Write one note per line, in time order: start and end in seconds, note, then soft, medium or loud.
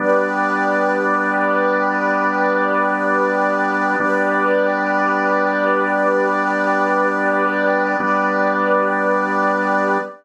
0.00 3.96 G3 medium
0.00 3.96 B3 medium
0.00 3.96 D4 medium
0.00 3.96 G4 loud
0.00 3.96 B4 medium
0.00 3.96 D5 medium
4.00 7.96 G3 medium
4.00 7.96 B3 medium
4.00 7.96 D4 medium
4.00 7.96 G4 loud
4.00 7.96 B4 medium
4.00 7.96 D5 loud
7.99 9.98 G3 medium
7.99 9.98 B3 medium
7.99 9.98 D4 medium
7.99 9.97 G4 medium
7.99 9.97 B4 medium
7.99 9.97 D5 loud